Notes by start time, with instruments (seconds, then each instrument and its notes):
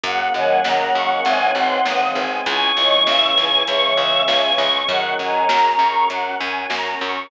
0.04 electric bass (finger) F#2, brass section A#3 C#4 F#4 G#4, string ensemble 1 F#5, choir aahs F#5, kick, closed hi-hat
0.34 electric bass (finger) F#2, choir aahs D#3 F#3, string ensemble 1 G#5
0.63 electric bass (finger) F#2, choir aahs D#3 F#3, brass section A#3 C#4 G#4 A#4, string ensemble 1 A#5, snare
0.94 electric bass (finger) F#2, string ensemble 1 C#6
1.25 electric bass (finger) G#1, choir aahs C#3 E3, brass section C4 D#4 G#4, string ensemble 1 G#5, closed hi-hat
1.55 electric bass (finger) G#1, string ensemble 1 C6
1.85 electric bass (finger) G#1, brass section G#3 C4 G#4, string ensemble 1 D#6, snare
2.15 electric bass (finger) G#1, string ensemble 1 G#5
2.46 electric bass (finger) C#2, brass section C#4 E4 G#4, string ensemble 1 G#5, choir aahs C#6, kick, closed hi-hat
2.76 electric bass (finger) C#2, choir aahs D#3 F#3, string ensemble 1 C#6
3.07 electric bass (finger) C#2, choir aahs C#3 E3, string ensemble 1 E6, snare
3.37 electric bass (finger) C#2, string ensemble 1 G#5
3.67 electric bass (finger) C#2, choir aahs C#3 E3 C#6, brass section G#3 C#4 G#4, string ensemble 1 C#6, closed hi-hat
3.97 electric bass (finger) C#2, string ensemble 1 E6
4.28 electric bass (finger) C#2, string ensemble 1 G#5, snare
4.58 electric bass (finger) C#2, string ensemble 1 C#6
4.88 electric bass (finger) F#2, choir aahs D#3 F#3 F#5, brass section C#4 F#4 G#4 A#4, string ensemble 1 F#5, kick, closed hi-hat
5.19 electric bass (finger) F#2, string ensemble 1 G#5, choir aahs A#5
5.49 electric bass (finger) F#2, string ensemble 1 A#5, snare
5.79 electric bass (finger) F#2, string ensemble 1 C#6
6.09 electric bass (finger) F#2, brass section C#4 F#4 A#4 C#5, string ensemble 1 F#5, closed hi-hat
6.39 electric bass (finger) F#2, string ensemble 1 G#5
6.70 electric bass (finger) F#2, string ensemble 1 A#5, snare
7.00 electric bass (finger) F#2, string ensemble 1 C#6